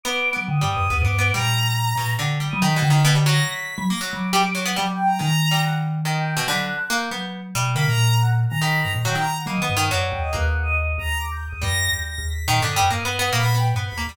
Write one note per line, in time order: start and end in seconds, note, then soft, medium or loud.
0.03 0.31 B3 loud
0.03 0.32 D6 medium
0.33 0.46 F#3 medium
0.33 0.59 B3 soft
0.47 0.61 D3 medium
0.47 0.66 D#6 soft
0.61 0.76 G2 medium
0.61 0.87 G3 medium
0.69 0.98 D#6 loud
0.77 0.90 F#2 medium
0.90 1.00 D#2 loud
0.90 1.03 B3 medium
1.00 1.31 G2 loud
1.00 1.29 D6 loud
1.05 1.17 B3 medium
1.19 1.31 B3 medium
1.33 1.93 A#2 medium
1.33 1.92 G3 medium
1.33 2.10 A#5 loud
1.96 2.15 A#2 medium
1.96 2.17 B2 medium
2.19 2.38 D3 medium
2.19 2.48 D3 medium
2.40 2.59 G3 medium
2.49 2.63 F#3 loud
2.49 2.59 D#6 loud
2.61 2.75 D#3 medium
2.61 2.81 D#3 medium
2.61 3.00 B6 medium
2.76 2.89 B2 medium
2.82 3.40 D3 loud
2.90 3.03 D#3 medium
3.05 3.14 B2 loud
3.15 3.25 G3 medium
3.26 3.84 F#3 loud
3.26 3.45 A#6 medium
3.46 3.84 B6 medium
3.78 3.87 F#3 loud
3.89 4.00 A#3 medium
3.89 3.98 A#6 loud
4.00 4.30 F#3 medium
4.00 4.10 F#6 medium
4.13 4.71 F#3 medium
4.13 4.62 D6 soft
4.33 4.43 G3 loud
4.55 4.64 F#3 medium
4.66 4.75 B3 loud
4.76 5.16 F#3 medium
4.76 4.86 G3 medium
4.76 4.90 D6 medium
4.93 5.06 G5 loud
5.05 5.17 A#5 medium
5.19 5.29 D#3 medium
5.19 6.36 D#3 loud
5.19 5.58 A#5 loud
5.51 5.99 G3 medium
5.63 5.73 F#5 medium
6.05 6.34 D#3 medium
6.05 6.16 D#5 medium
6.15 6.44 G5 medium
6.37 6.46 B2 loud
6.47 6.77 D3 loud
6.47 6.67 F#3 medium
6.47 6.57 B5 medium
6.59 6.88 F#6 loud
6.90 7.09 A#3 loud
6.90 7.28 G6 medium
7.11 7.50 F#3 medium
7.11 7.40 B3 medium
7.55 7.74 B2 medium
7.55 7.74 G3 loud
7.75 7.85 D3 medium
7.75 8.53 A#3 medium
7.75 7.84 B5 loud
7.86 8.46 A#2 medium
7.86 8.15 A#5 loud
8.20 8.29 F#5 medium
8.49 8.81 D#3 medium
8.49 8.59 A#5 loud
8.60 9.00 D#3 medium
8.60 8.79 B5 medium
8.81 8.94 G2 medium
8.81 8.91 A#5 loud
8.95 9.05 A#2 medium
9.05 9.44 D#3 medium
9.05 9.15 F#3 loud
9.05 9.16 G5 loud
9.15 9.25 D#3 medium
9.15 9.35 A#5 medium
9.36 9.46 F#5 medium
9.46 9.56 F#3 medium
9.46 9.60 A#3 medium
9.46 9.85 D#5 medium
9.57 9.67 D#3 medium
9.62 9.75 B3 medium
9.69 9.89 G2 medium
9.77 9.89 D#3 loud
9.90 10.11 F#2 medium
9.90 10.30 F#3 loud
9.90 10.03 D5 medium
10.06 10.18 G5 medium
10.12 10.31 D#2 medium
10.19 10.32 D#5 medium
10.31 10.92 D#2 loud
10.31 11.48 A#3 medium
10.31 10.44 B4 loud
10.49 10.62 F#5 medium
10.62 10.75 D#5 loud
10.76 10.96 D#5 medium
10.98 11.46 D#2 medium
10.98 11.17 A#5 loud
11.18 11.31 D6 medium
11.31 11.44 G6 loud
11.47 11.60 D#6 medium
11.52 11.62 D#2 medium
11.62 11.89 F#2 loud
11.62 12.39 G3 medium
11.62 11.91 A#6 loud
11.91 12.17 D#2 medium
11.91 12.03 G6 medium
12.05 12.25 A#6 medium
12.18 12.44 D#2 medium
12.27 12.66 B6 medium
12.48 12.58 A#2 medium
12.48 12.61 D#3 loud
12.59 12.78 G2 medium
12.59 12.75 D3 medium
12.69 12.79 D#6 medium
12.76 12.89 F#2 medium
12.76 12.89 G3 loud
12.76 12.89 F#6 soft
12.90 13.29 G2 soft
12.90 13.03 A#3 medium
12.90 13.31 D#6 medium
13.05 13.18 B3 medium
13.19 13.32 B3 loud
13.33 13.71 A#2 medium
13.33 13.42 A#3 loud
13.33 13.54 B5 loud
13.43 13.53 B3 medium
13.55 13.74 B3 medium
13.55 13.66 G5 loud
13.74 13.87 G2 medium
13.74 13.95 B3 medium
13.74 13.83 F#5 medium
13.87 14.06 B5 medium
13.92 14.05 D#2 medium
13.97 14.07 A#3 medium
14.07 14.16 D#2 medium
14.07 14.16 G3 medium
14.07 14.16 B5 loud